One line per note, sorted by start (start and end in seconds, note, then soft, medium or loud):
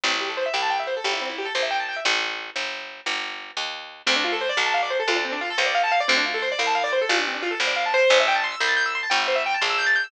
0.04 0.49 A1 medium
0.04 0.11 C4 medium
0.11 0.19 E4 medium
0.21 0.28 G4 medium
0.29 0.36 A4 medium
0.37 0.45 C5 medium
0.46 0.53 E5 medium
0.54 0.99 C2 medium
0.54 0.61 G5 medium
0.62 0.70 A5 medium
0.70 0.78 G5 medium
0.80 0.87 E5 medium
0.87 0.95 C5 medium
0.97 1.04 A4 medium
1.04 1.50 G1 medium
1.04 1.12 G4 medium
1.13 1.20 E4 medium
1.21 1.29 C4 medium
1.29 1.37 E4 medium
1.38 1.46 G4 medium
1.45 1.53 A4 medium
1.55 2.00 A#1 medium
1.55 1.62 C5 medium
1.63 1.70 E5 medium
1.71 1.78 G5 medium
1.80 1.87 A5 medium
1.89 1.96 G5 medium
1.96 2.04 E5 medium
2.05 2.50 A1 medium
2.56 3.01 G1 medium
3.06 3.52 G1 medium
3.57 4.02 D#2 medium
4.07 4.52 D2 medium
4.07 4.14 C4 loud
4.16 4.24 D4 medium
4.24 4.32 F4 medium
4.32 4.40 A4 medium
4.41 4.49 C5 loud
4.49 4.57 D5 loud
4.57 5.02 B1 medium
4.57 4.65 F5 medium
4.66 4.74 A5 medium
4.74 4.81 F5 medium
4.83 4.90 D5 medium
4.90 4.98 C5 medium
5.00 5.07 A4 medium
5.08 5.53 D2 medium
5.08 5.16 F4 loud
5.16 5.24 D4 medium
5.25 5.32 C4 loud
5.32 5.40 D4 loud
5.41 5.49 F4 loud
5.50 5.58 A4 loud
5.58 6.03 C#2 medium
5.58 5.65 C5 medium
5.66 5.74 D5 medium
5.75 5.82 F5 loud
5.84 5.91 A5 medium
5.92 5.99 F5 loud
6.00 6.08 D5 loud
6.08 6.54 D2 medium
6.08 6.16 C4 loud
6.17 6.25 D4 loud
6.26 6.33 F4 medium
6.34 6.42 A4 medium
6.42 6.50 C5 loud
6.52 6.59 D5 loud
6.59 7.04 C2 medium
6.59 6.66 F5 medium
6.67 6.74 A5 medium
6.75 6.82 F5 loud
6.84 6.91 D5 loud
6.93 7.00 C5 medium
7.01 7.09 A4 medium
7.09 7.55 A1 medium
7.09 7.17 F4 loud
7.18 7.25 D4 medium
7.27 7.34 C4 medium
7.34 7.42 D4 medium
7.42 7.50 F4 loud
7.51 7.58 A4 medium
7.60 8.05 G#1 medium
7.60 7.68 C5 medium
7.67 7.75 D5 medium
7.76 7.84 F5 medium
7.86 7.93 A5 medium
7.94 8.18 C5 loud
8.10 8.56 A1 loud
8.20 8.27 E5 loud
8.28 8.35 G5 loud
8.35 8.42 A5 medium
8.44 8.51 C6 loud
8.52 8.59 E6 medium
8.60 9.06 C2 medium
8.60 8.69 G6 loud
8.68 8.76 A6 medium
8.77 8.84 G6 loud
8.86 8.93 E6 medium
8.95 9.03 C6 medium
9.03 9.11 A5 medium
9.10 9.56 G1 medium
9.10 9.18 G5 medium
9.20 9.27 E5 medium
9.28 9.35 C5 medium
9.35 9.43 E5 loud
9.46 9.53 G5 loud
9.54 9.62 A5 medium
9.61 10.07 A#1 medium
9.61 9.69 C6 medium
9.70 9.78 E6 medium
9.78 9.86 G6 loud
9.86 9.94 A6 loud
9.96 10.03 G6 medium
10.04 10.11 E6 medium